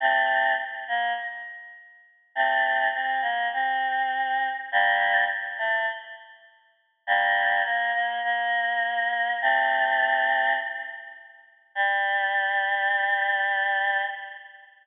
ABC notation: X:1
M:4/4
L:1/8
Q:1/4=102
K:Gdor
V:1 name="Choir Aahs"
[A,C]2 z B, z4 | [A,C]2 C B, C4 | [G,B,]2 z A, z4 | [G,B,]2 B, B, B,4 |
[A,C]4 z4 | G,8 |]